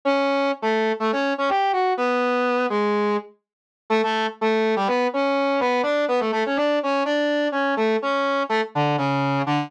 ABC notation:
X:1
M:4/4
L:1/16
Q:1/4=124
K:D
V:1 name="Brass Section"
[Cc]4 z [A,A]3 [A,A] [Cc]2 [Cc] [Gg]2 [Ff]2 | [B,B]6 [^G,^G]4 z6 | [A,A] [A,A]2 z [A,A]3 [G,G] [B,B]2 [Cc]4 [B,B]2 | [Dd]2 [B,B] [A,A] [A,A] [Cc] [Dd]2 [Cc]2 [Dd]4 [Cc]2 |
[A,A]2 [Cc]4 [A,A] z [D,D]2 [C,C]4 [D,D]2 |]